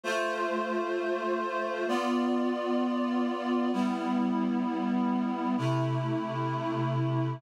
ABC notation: X:1
M:4/4
L:1/8
Q:1/4=65
K:C
V:1 name="Clarinet"
[A,Fc]4 [B,Fd]4 | [G,B,E]4 [C,A,E]4 |]